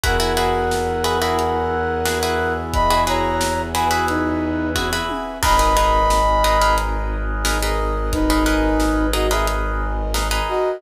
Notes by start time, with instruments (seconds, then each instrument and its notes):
0.04 violin E2, pizzicato strings E4 F#4 G#4 B4, brass section A#4 B4 E5 F#5 G#5, kick, closed hi-hat
0.20 pizzicato strings E4 F#4 G#4 B4
0.37 pizzicato strings E4 F#4 G#4 B4
0.71 snare
1.04 pizzicato strings E4 F#4 G#4 B4
1.21 pizzicato strings E4 F#4 G#4 B4
1.39 closed hi-hat
2.05 pizzicato strings E4 F#4 G#4 B4, snare
2.23 pizzicato strings E4 F#4 G#4 B4
2.73 brass section D#5 B5, kick, closed hi-hat
2.90 pizzicato strings E4 F#4 G#4 B4
3.07 pizzicato strings E4 F#4 G#4 B4, brass section C#5 A#5
3.41 snare
3.74 pizzicato strings E4 F#4 G#4 B4, brass section B4 G#5
3.91 pizzicato strings E4 F#4 G#4 B4
4.08 brass section D#4 B4, closed hi-hat
4.75 pizzicato strings E4 F#4 G#4 B4, kick, high tom
4.93 pizzicato strings E4 F#4 G#4 B4
5.09 high tom
5.42 violin G#1, pizzicato strings D#4 G#4 A#4 B4, brass section A#4 B4 D#5 G#5 B5, kick, crash
5.59 pizzicato strings D#4 G#4 A#4 B4
5.77 pizzicato strings D#4 G#4 A#4 B4
6.10 snare
6.44 pizzicato strings D#4 G#4 A#4 B4
6.62 pizzicato strings D#4 G#4 A#4 B4
6.78 closed hi-hat
7.45 pizzicato strings D#4 G#4 A#4 B4, snare
7.62 pizzicato strings D#4 G#4 A#4 B4
8.12 brass section D#4 B4, kick, closed hi-hat
8.30 pizzicato strings D#4 G#4 A#4 B4
8.46 pizzicato strings D#4 G#4 A#4 B4
8.80 snare
9.13 pizzicato strings D#4 G#4 A#4 B4, brass section F#4 D#5
9.31 pizzicato strings D#4 G#4 A#4 B4, brass section G#4 E5
9.47 closed hi-hat
10.14 pizzicato strings D#4 G#4 A#4 B4, snare
10.31 pizzicato strings D#4 G#4 A#4 B4
10.48 brass section F#4 D#5